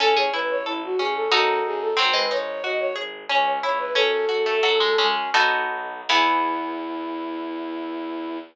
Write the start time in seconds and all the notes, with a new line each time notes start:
0.00 A1 C#4 A4
0.16 G#4 C#5
0.33 A1 E4 B4
0.50 C#5
0.65 A1 E4 A4
0.84 F#4
0.98 A1 C#4 G#4
1.16 A4
1.31 F#2 D#4 F#4 A4
1.65 F#2 G#4
1.81 A4
1.97 G#1 F#3 C4 C5
2.13 G#3 B4
2.31 G#1 D#4 C#5
2.64 G#1 F#4 D#5
2.80 C#5
2.96 G#1 G#4
3.29 C#2 C#4 C#5
3.63 C#2 E4 C#5
3.79 B4
3.95 F#2 C#4 A4
4.29 F#2 F#4
4.46 A3
4.63 F#2 F#3 A4
4.80 G#3
4.98 F#2 G#3 C#4
5.34 B1 B3 D#4 F#4 A4
5.71 B1
6.08 E2 E3 B3 E4 G#4